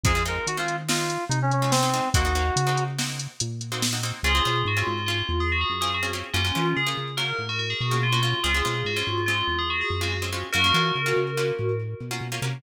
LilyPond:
<<
  \new Staff \with { instrumentName = "Electric Piano 2" } { \time 5/4 \key des \major \tempo 4 = 143 aes'8 bes'8 ges'16 f'8 r16 f'4 ees'16 des'16 des'8 c'4 | ges'2 r2. | r1 r4 | r1 r4 |
r1 r4 | r1 r4 | }
  \new Staff \with { instrumentName = "Tubular Bells" } { \time 5/4 \key des \major r1 r4 | r1 r4 | <f' aes'>4 ges'16 f'8. f'8. aes'16 ges'16 aes'16 r16 aes'16 ges'16 r8. | <des' f'>4 aes'16 r8. bes'8. ges'16 ges'16 aes'16 ges'16 ges'16 f'16 ges'16 f'8 |
<f' aes'>4 ges'16 f'8. f'8. aes'16 ges'16 aes'16 r16 ges'16 ges'16 r8. | <ges' bes'>2. r2 | }
  \new Staff \with { instrumentName = "Pizzicato Strings" } { \time 5/4 \key des \major <aes c' ees' f'>16 <aes c' ees' f'>16 <aes c' ees' f'>8. <aes c' ees' f'>8. <aes c' ees' f'>4.~ <aes c' ees' f'>16 <aes c' ees' f'>8 <aes c' ees' f'>16 <aes c' ees' f'>8 | <bes c' ees' ges'>16 <bes c' ees' ges'>16 <bes c' ees' ges'>8. <bes c' ees' ges'>8. <bes c' ees' ges'>4.~ <bes c' ees' ges'>16 <bes c' ees' ges'>8 <bes c' ees' ges'>16 <bes c' ees' ges'>8 | <c' des' f' aes'>16 <c' des' f' aes'>16 <c' des' f' aes'>8. <c' des' f' aes'>8. <c' des' f' aes'>4.~ <c' des' f' aes'>16 <c' des' f' aes'>8 <c' des' f' aes'>16 <c' des' f' aes'>8 | <bes des' f' ges'>16 <bes des' f' ges'>16 <bes des' f' ges'>8. <bes des' f' ges'>8. <bes des' f' ges'>4.~ <bes des' f' ges'>16 <bes des' f' ges'>8 <bes des' f' ges'>16 <bes des' f' ges'>8 |
<aes c' des' f'>16 <aes c' des' f'>16 <aes c' des' f'>8. <aes c' des' f'>8. <aes c' des' f'>4.~ <aes c' des' f'>16 <aes c' des' f'>8 <aes c' des' f'>16 <aes c' des' f'>8 | <bes des' f' ges'>16 <bes des' f' ges'>16 <bes des' f' ges'>8. <bes des' f' ges'>8. <bes des' f' ges'>4.~ <bes des' f' ges'>16 <bes des' f' ges'>8 <bes des' f' ges'>16 <bes des' f' ges'>8 | }
  \new Staff \with { instrumentName = "Synth Bass 1" } { \clef bass \time 5/4 \key des \major f,4 ees2 c2 | ees,4 des2 bes,2 | des,8 b,8 aes,8 aes,4 e,4 ges,4. | ges,8 e8 des8 des4 a,4 b,4. |
des,8 b,8 aes,8 aes,4 e,4 ges,4. | ges,8 e8 des8 des4 a,4 b,8 b,8 c8 | }
  \new DrumStaff \with { instrumentName = "Drums" } \drummode { \time 5/4 <hh bd>8 hh8 hh8 hh8 sn8 hh8 hh8 hh8 sn8 hh8 | <hh bd>8 hh8 hh8 hh8 sn8 hh8 hh8 hh8 sn8 hh8 | r4 r4 r4 r4 r4 | r4 r4 r4 r4 r4 |
r4 r4 r4 r4 r4 | r4 r4 r4 r4 r4 | }
>>